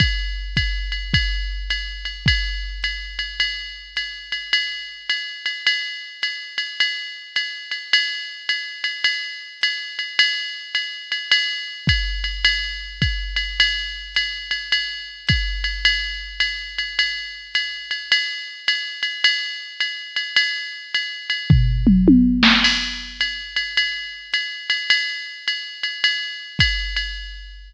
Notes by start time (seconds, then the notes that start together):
0.00 kick, ride
0.56 kick, hi-hat pedal, ride
0.92 ride
1.14 kick, ride
1.70 hi-hat pedal, ride
2.05 ride
2.26 kick, ride
2.83 hi-hat pedal, ride
3.19 ride
3.40 ride
3.96 hi-hat pedal, ride
4.32 ride
4.53 ride
5.10 hi-hat pedal, ride
5.46 ride
5.67 ride
6.22 hi-hat pedal, ride
6.58 ride
6.80 ride
7.36 hi-hat pedal, ride
7.71 ride
7.93 ride
8.49 hi-hat pedal, ride
8.84 ride
9.04 ride
9.61 hi-hat pedal, ride
9.99 ride
10.19 ride
10.75 hi-hat pedal, ride
11.12 ride
11.31 ride
11.87 kick, hi-hat pedal, ride
12.24 ride
12.45 ride
13.02 kick, hi-hat pedal, ride
13.36 ride
13.60 ride
14.15 hi-hat pedal, ride
14.51 ride
14.72 ride
15.27 kick, hi-hat pedal, ride
15.64 ride
15.85 ride
16.40 hi-hat pedal, ride
16.78 ride
16.99 ride
17.54 hi-hat pedal, ride
17.91 ride
18.12 ride
18.68 hi-hat pedal, ride
19.03 ride
19.24 ride
19.80 hi-hat pedal, ride
20.16 ride
20.36 ride
20.94 hi-hat pedal, ride
21.30 ride
21.50 kick, floor tom
21.87 mid tom
22.08 high tom
22.43 snare
22.64 crash, ride
23.20 hi-hat pedal, ride
23.56 ride
23.77 ride
24.33 hi-hat pedal, ride
24.70 ride
24.90 ride
25.48 hi-hat pedal, ride
25.83 ride
26.04 ride
26.59 kick, hi-hat pedal, ride
26.96 ride